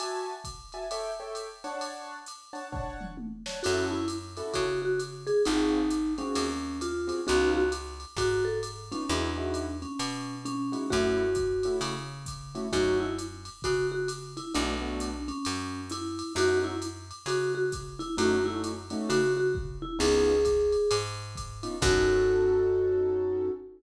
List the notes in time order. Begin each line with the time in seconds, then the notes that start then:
0.00 F#4 E5 G#5 A5, ride
0.44 kick, hi-hat pedal, ride
0.72 F#4 E5 G#5 A5, ride
0.91 A4 C#5 E5 G5, ride
1.20 A4 C#5 E5 G5
1.35 hi-hat pedal, ride
1.64 D4 C#5 F#5 A5, ride
1.81 ride
2.26 hi-hat pedal, ride
2.53 D4 C#5 F#5 A5, ride
2.72 D4 C#5 F#5 A5, kick, floor tom
3.01 mid tom
3.17 high tom
3.46 D4 C#5 F#5 A5, snare
3.63 F#2 C#4 E4 F#4 A4, crash, ride
3.91 E4
4.08 hi-hat pedal, ride
4.37 C#4 E4 F#4 A4, ride
4.54 C#3 F#4, kick, ride
4.82 F#4
5.00 hi-hat pedal, ride
5.27 G#4, ride
5.45 G#1 C4 D#4 F4 F#4 G#4, ride
5.91 hi-hat pedal, ride
6.18 C4 C#4 F4 F#4 G#4, ride
6.35 D#2, ride
6.81 F4, hi-hat pedal, ride
7.07 C4 F4 F#4 G#4, ride
7.27 C#2 B3 C#4 D#4 F4 F#4, ride
7.55 F#4
7.72 hi-hat pedal, ride
8.00 ride
8.16 G#2 F#4, kick, ride
8.45 A4
8.63 hi-hat pedal, ride
8.92 B3 C#4 D#4 F4, ride
9.09 E2 G#3 D4 D#4 E4 F#4, ride
9.38 G#3 D#4 E4 F#4
9.54 hi-hat pedal, ride
9.82 C#4, ride
9.99 B2, ride
10.45 C#4, hi-hat pedal, ride
10.72 G#3 D#4 E4 F#4, ride
10.90 F#2 A3 C#4 E4 F#4, kick, ride
11.35 kick, hi-hat pedal, ride
11.63 A3 C#4 E4 F#4, ride
11.81 C#3, ride
12.26 kick, hi-hat pedal, ride
12.55 A3 C#4 E4 F#4, ride
12.72 F#2 A3 C#4 D#4 F#4, kick, ride
13.00 E4
13.18 hi-hat pedal, ride
13.45 ride
13.62 C#3 F#4, kick, ride
13.92 F#4
14.08 hi-hat pedal, ride
14.37 E4, ride
14.54 B1 A3 B3 D4 F#4, ride
14.81 A3 B3 D4 F#4
15.00 hi-hat pedal, ride
15.28 C#4, ride
15.45 F#2, ride
15.90 E4, hi-hat pedal, ride
16.19 ride
16.35 F#2 A3 C#4 D#4 F#4, ride
16.64 E4
16.82 hi-hat pedal, ride
17.11 ride
17.26 C#3 F#4, ride
17.55 F#4
17.72 kick, hi-hat pedal, ride
17.99 E4, ride
18.17 F#2 A3 C#4 D#4 F#4, ride
18.44 A3 C#4 D#4 E4 F#4
18.64 hi-hat pedal, ride
18.90 A3 C#4 D#4 F#4, ride
19.09 C#3 F#4, ride
19.37 F#4
19.55 kick
19.82 E4
19.99 C#2 B3 C#4 D#4 F4 G#4, crash, ride
20.45 kick, hi-hat pedal, ride
20.72 ride
20.91 G#2, ride
21.36 kick, hi-hat pedal, ride
21.63 B3 C#4 D#4 F4, ride
21.81 F#2 C#4 D#4 F#4 A4, kick, crash